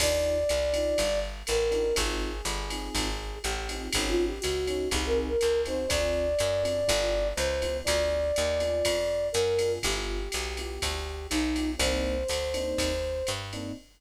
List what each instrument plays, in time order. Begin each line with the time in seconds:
0.00 electric bass (finger) D#2, electric piano 1 D4 D#4 F4 G4, flute D5, kick, crash, ride
0.49 electric bass (finger) C2, hi-hat pedal, ride
0.73 electric piano 1 D4 D#4 F4 G4, ride
0.98 electric bass (finger) G1, kick, ride
1.47 electric bass (finger) A1, flute A#4, hi-hat pedal, ride
1.71 electric piano 1 D4 D#4 F4 G4, ride
1.96 electric bass (finger) G#1, electric piano 1 C4 D#4 F4 G#4, flute G#4, kick, ride
2.45 electric bass (finger) G1, hi-hat pedal, ride
2.70 electric piano 1 C4 D#4 F4 G#4, ride
2.95 electric bass (finger) G#1, kick, ride
3.43 electric bass (finger) A1, flute G4, hi-hat pedal, ride
3.69 electric piano 1 C4 D#4 F4 G#4, ride
3.93 electric bass (finger) G#1, electric piano 1 C#4 D#4 F#4 G#4, flute G#4, kick, ride
4.08 flute F4
4.27 flute G4
4.41 electric bass (finger) C#2, flute F#4, hi-hat pedal, ride
4.67 electric piano 1 C#4 D#4 F#4 G#4, ride
4.91 electric bass (finger) C2, electric piano 1 C4 D#4 F#4 G#4, flute G#4, kick, ride
5.06 flute A#4
5.15 flute G#4
5.28 flute A#4
5.39 electric bass (finger) C#2, flute A#4, hi-hat pedal, ride
5.65 electric piano 1 C4 D#4 F#4 G#4, flute C5, ride
5.88 electric bass (finger) D2, electric piano 1 C4 D4 F4 G#4, flute D5, kick, ride
6.39 electric bass (finger) F#2, hi-hat pedal, ride
6.63 electric piano 1 C4 D4 F4 G#4, ride
6.88 electric bass (finger) G1, electric piano 1 B3 E4 F4 G4, kick, ride
7.36 electric bass (finger) C#2, flute C5, hi-hat pedal, ride
7.62 electric piano 1 B3 E4 F4 G4, ride
7.84 electric bass (finger) D2, electric piano 1 B3 D4 F4 G#4, flute D5, kick, ride
8.36 electric bass (finger) D#2, hi-hat pedal, ride
8.60 electric piano 1 B3 D4 F4 G#4, ride
8.85 electric bass (finger) F2, kick, ride
9.32 electric bass (finger) F#2, flute A#4, hi-hat pedal, ride
9.59 electric piano 1 B3 D4 F4 G#4, ride
9.83 electric bass (finger) G1, electric piano 1 B3 E4 F4 G4, flute G4, kick, ride
10.32 electric bass (finger) B1, hi-hat pedal, ride
10.57 electric piano 1 B3 E4 F4 G4, ride
10.82 electric bass (finger) D2, kick, ride
11.30 electric bass (finger) B1, flute D#4, hi-hat pedal, ride
11.56 electric piano 1 B3 E4 F4 G4, ride
11.78 electric bass (finger) C2, electric piano 1 A#3 C4 D4 D#4, flute C5, kick, ride
12.28 electric bass (finger) D2, hi-hat pedal, ride
12.54 electric piano 1 A#3 C4 D4 D#4, ride
12.78 electric bass (finger) D#2, kick, ride
13.27 electric bass (finger) G2, hi-hat pedal, ride
13.53 electric piano 1 A#3 C4 D4 D#4, ride